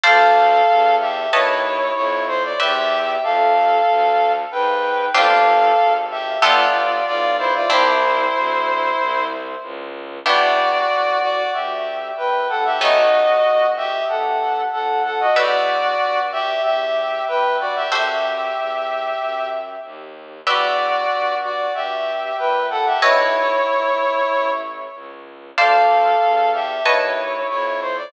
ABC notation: X:1
M:4/4
L:1/16
Q:1/4=94
K:Dm
V:1 name="Brass Section"
[Af]6 [Ge]2 [E^c]4 [Ec]2 =c d | [Ge]4 [Af]8 [=Bg]4 | [Af]6 [Ge]2 [Fd]4 [Fd]2 [Ec] [Fd] | [Ec]10 z6 |
[K:Em] [Fd]6 [Fd]2 [Ge]4 [Bg]2 [Af] [Ge] | [F^d]6 [Ge]2 [Af]4 [Af]2 [Af] [Fd] | [Fd]6 [Ge]2 [Ge]4 [Bg]2 [Fd] [Ge] | [Ge]10 z6 |
[Fd]6 [Fd]2 [Ge]4 [Bg]2 [Af] [Ge] | [E^c]10 z6 | [K:Dm] [Af]6 [Ge]2 [E^c]4 [Ec]2 =c d |]
V:2 name="Acoustic Guitar (steel)"
[cdfa]8 [=B^c^da]8 | [=Bdeg]16 | [CDFG]8 [=B,FGA]8 | [CDEG]16 |
[K:Em] [B,DEG]16 | [A,B,^C^D]16 | [GBde]16 | [FAce]16 |
[GBde]16 | [AB^c^d]16 | [K:Dm] [cdfa]8 [=B^c^da]8 |]
V:3 name="Violin" clef=bass
D,,4 E,,4 ^D,,4 F,,4 | E,,4 F,,4 D,,4 _A,,4 | G,,,4 _A,,,4 G,,,4 =B,,,4 | C,,4 D,,4 C,,4 ^C,,4 |
[K:Em] E,,4 C,,4 D,,4 ^A,,,2 B,,,2- | B,,,4 G,,,4 A,,,4 =F,,4 | E,,4 G,,4 E,,4 G,,4 | F,,4 E,,4 F,,4 ^D,,4 |
E,,4 G,,4 G,,4 ^A,,4 | B,,,4 G,,,4 A,,,4 ^C,,4 | [K:Dm] D,,4 E,,4 ^D,,4 F,,4 |]